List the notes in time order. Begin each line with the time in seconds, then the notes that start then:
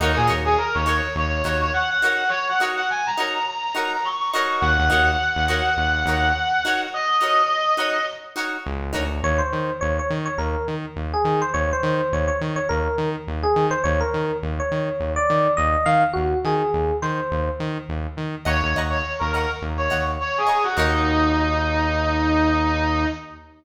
0.00 D#2 D#4 F#4 A#4 C#5
0.16 A#2 G#4
0.27 D#2 D#4 F#4 A#4 C#5
0.45 G#4
0.58 A#4
0.74 D#2 C#5
0.85 D#4 F#4 A#4 C#5
1.16 D#2 C#5
1.44 D#2 D#4 F#4 A#4 C#5
1.60 C#5
1.73 F#5
1.89 F#5
2.02 D#4 F#4 A#4 C#5 F#5
2.29 C#5
2.49 F#5
2.60 D#4 F#4 A#4 C#5
2.76 F#5
2.90 G#5
3.06 A#5
3.17 D#4 F#4 A#4 C#5 A#5
3.48 A#5
3.75 D#4 F#4 A#4 C#5 A#5
3.93 A#5
4.04 C#6
4.20 C#6
4.31 D#4 F#4 A#4 C#6
4.36 C#5
4.61 D#2 F#5
4.79 D#2
4.90 D#2 D#4 F#4 A#4 C#5
5.36 D#2
5.48 D#4 F#4 A#4 C#5
5.77 D#2
6.06 D#2 D#4 F#4 A#4 C#5
6.65 D#4 F#4 A#4 C#5
6.94 D#5
7.21 D#4 F#4 A#4 C#5
7.77 D#4 F#4 A#4 C#5
8.36 D#4 F#4 A#4 C#5
8.66 C#2
8.93 D2 D#4 F#4 A#4 C#5
9.23 D#2 C#5
9.38 C5
9.53 D#3
9.81 D#2 C#5
9.99 C#5
10.10 D#3
10.26 C#5
10.38 D#2 A#4
10.68 D#3
10.96 D#2
11.14 G#4
11.25 D#3
11.42 C5
11.54 D#2 C#5
11.73 C5
11.83 D#3
12.12 D#2 C#5
12.28 C#5
12.41 D#3
12.56 C#5
12.69 D#2 A#4
12.98 D#3
13.27 D#2
13.43 G#4
13.56 D#3
13.71 C5
13.84 D#2 C#5
14.00 A#4
14.14 D#3
14.43 D#2
14.60 C#5
14.72 D#3
15.00 D#2
15.16 D5
15.30 D#3
15.57 D#2 D#5
15.86 D#3 F5
16.13 D#2 F#4
16.45 D#3 G#4
16.74 D#2
17.02 D#3 C5
17.31 D#2
17.60 D#3
17.89 D#2
18.17 D#3
18.45 D#2 C#5 D#5 F#5 A#5 C#6
18.63 D#2
18.75 D#2 D#5 F#5 A#5 C#6
18.90 C#5
19.19 D#2 A#4
19.33 A#4 D#5 F#5 A#5
19.37 C#6
19.62 D#2
19.78 C#5
19.90 D#2 D#5 F#5 A#5 C#6
20.21 C#5
20.38 G#4
20.47 D#5 F#5 A#5 C#6
20.63 F#4
20.76 D#2 D#4 F#4 A#4 C#5